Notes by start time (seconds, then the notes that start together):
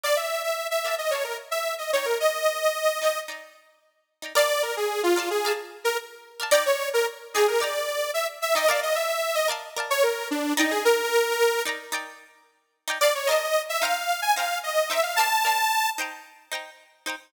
0.03 A#4 D5 F5 A5
0.16 E5
0.43 E5
0.71 E5
0.84 A#4 D5 F5 A5
0.98 D#5
1.11 A#4 C#5 D5 F5
1.15 A5
1.24 A#4
1.51 E5
1.78 D#5
1.93 D#4 C#5 D5 G5
1.97 A#5
2.05 A#4
2.20 D#5
3.01 D#4 D5 G5 A#5
3.28 D#4 D5 G5 A#5
4.22 D#4 D5 G5 A#5
4.35 A#4 D5 F5 A5
4.63 A#4
4.77 G#4
5.03 F4
5.16 A#4 D5 F5 A5
5.30 G#4
5.45 A#4 D5 F5 A5
5.84 A#4
6.40 A#4 D5 F5 A5
6.51 D#4 D5 G5 A#5
6.66 C#5
6.93 A#4
7.34 D#4 G#4 D5 G5
7.38 A#5
7.48 A#4
7.60 D#4 D5 G5 A#5
8.14 E5
8.42 E5
8.55 D#4 D5 D#5 G5 A#5
8.67 A#4 D5 F5
8.72 A5
8.83 D#5
8.95 E5
9.35 D#5
9.48 A#4 D5 F5 A5
9.76 A#4 D5 F5 A5
9.90 C#5
10.03 A#4
10.31 D4
10.57 D#4 D5 G5 A#5
10.71 G#4
10.85 A#4
11.65 D#4 D5 G5 A#5
11.92 D#4 D5 G5 A#5
12.88 D#4 D5 G5 A#5
13.01 A#4 D5 F5 A5
13.15 C#5
13.27 A#4 D5 D#5
13.31 F5 A5
13.69 E5
13.82 D#4 C5 F5 G5 A#5
14.22 G#5
14.36 D#4 C5 F5 G5 A#5
14.63 D#5
14.90 D#4 C5 E5 G5 A#5
15.03 F5
15.16 A#4 D5 A5
15.20 F5 A5
15.45 A#4 D5 F5 A5
15.98 D#4 C5 G5 A#5
16.52 D#4 C5 G5 A#5
17.06 D#4 C5 G5 A#5